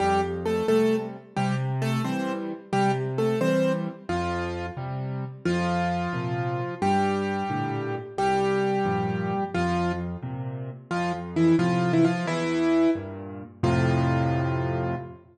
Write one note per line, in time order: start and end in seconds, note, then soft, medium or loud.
0.00 0.62 F2 medium
0.00 0.21 G3 medium
0.00 0.21 G4 loud
0.45 0.66 A3 medium
0.45 0.66 A4 medium
0.68 1.17 C3 medium
0.68 1.17 G3 medium
0.68 0.96 A3 medium
0.68 0.96 A4 medium
1.36 1.99 C3 medium
1.36 1.55 G3 medium
1.36 1.55 G4 medium
1.82 2.02 A3 medium
1.82 2.02 A4 loud
2.04 2.53 E3 medium
2.04 2.53 G3 medium
2.04 2.32 C4 medium
2.04 2.32 C5 medium
2.73 3.35 C3 medium
2.73 2.91 G3 medium
2.73 2.91 G4 loud
3.18 3.39 A3 medium
3.18 3.39 A4 medium
3.41 3.89 E3 medium
3.41 3.89 G3 medium
3.41 3.72 C4 medium
3.41 3.72 C5 medium
4.09 4.70 F2 medium
4.09 4.66 F3 medium
4.09 4.66 F4 medium
4.77 5.25 C3 medium
4.77 5.25 G3 medium
5.45 6.08 F2 medium
5.45 6.75 F3 medium
5.45 6.75 F4 loud
6.13 6.61 A#2 medium
6.13 6.61 C3 medium
6.82 7.43 G2 medium
6.82 7.95 G3 medium
6.82 7.95 G4 loud
7.50 7.97 A2 medium
7.50 7.97 A#2 medium
7.50 7.97 D3 medium
8.18 8.79 C2 medium
8.18 9.44 G3 medium
8.18 9.44 G4 loud
8.85 9.33 G2 medium
8.85 9.33 A#2 medium
8.85 9.33 F3 medium
9.54 10.17 F2 medium
9.54 9.92 F3 medium
9.54 9.92 F4 loud
10.23 10.70 A#2 medium
10.23 10.70 C3 medium
10.91 11.53 F2 medium
10.91 11.12 F3 medium
10.91 11.12 F4 medium
11.36 11.56 E3 medium
11.36 11.56 E4 medium
11.59 12.06 A2 medium
11.59 12.06 C3 medium
11.59 11.92 F3 medium
11.59 11.92 F4 loud
11.93 12.04 E3 medium
11.93 12.04 E4 medium
12.04 12.26 F3 medium
12.04 12.26 F4 medium
12.26 12.87 E2 medium
12.26 12.90 E3 loud
12.26 12.90 E4 loud
12.95 13.43 G2 medium
12.95 13.43 A#2 medium
13.63 14.95 F2 loud
13.63 14.95 A2 loud
13.63 14.95 C3 loud
13.63 14.95 F4 loud